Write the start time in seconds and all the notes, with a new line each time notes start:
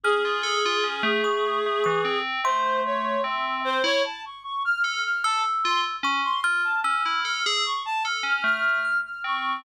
0.04 C#4 G#4 F6
0.25 F4
0.43 A4
0.65 F4
0.84 C#4
1.03 A3
1.24 A3 C#6
1.66 A3
1.84 E3 C#6
2.05 C4
2.44 A3 C5 C6
2.85 C#5
3.24 C4 E5
3.65 C5
3.84 E4 C#5
4.04 A5
4.25 C#6
4.45 C#6
4.65 F6
4.83 A4 F6
5.04 F6
5.24 A4 A5 E6
5.64 F4 C6
6.03 C#4 C#6
6.24 C6
6.44 F4 F6
6.64 A5
6.84 C#4 E6 F6
7.05 E4 F6
7.25 A4 F6
7.45 G#4 E6
7.65 C#6
7.85 A5
8.04 A4 F6
8.23 C#4 F6
8.44 A3 F6
8.85 F6
9.05 F6
9.24 C4 C#6